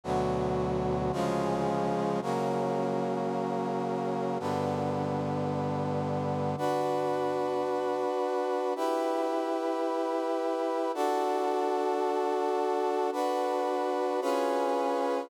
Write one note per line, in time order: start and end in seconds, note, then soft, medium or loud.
0.04 1.12 D2 loud
0.04 1.12 B2 medium
0.04 1.12 F#3 loud
1.12 2.20 C#3 loud
1.12 2.20 F3 loud
1.12 2.20 G#3 loud
2.22 4.38 C#3 medium
2.22 4.38 F#3 medium
2.22 4.38 A#3 medium
4.40 6.55 G2 medium
4.40 6.55 D3 medium
4.40 6.55 B3 medium
6.58 8.74 D4 medium
6.58 8.74 F#4 medium
6.58 8.74 B4 medium
8.76 10.92 E4 loud
8.76 10.92 G4 medium
8.76 10.92 B4 medium
10.94 13.10 D4 loud
10.94 13.10 F#4 loud
10.94 13.10 A4 loud
13.12 14.20 D4 medium
13.12 14.20 F#4 medium
13.12 14.20 B4 loud
14.21 15.29 C#4 loud
14.21 15.29 F4 medium
14.21 15.29 G#4 medium
14.21 15.29 B4 loud